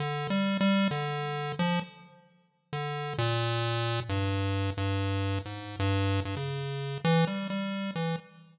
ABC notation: X:1
M:6/4
L:1/16
Q:1/4=132
K:none
V:1 name="Lead 1 (square)" clef=bass
(3D,4 G,4 G,4 D,6 F,2 z8 | D,4 _B,,8 G,,6 G,,6 | _A,,3 G,,4 G,, _D,6 E,2 G,2 G,4 E,2 |]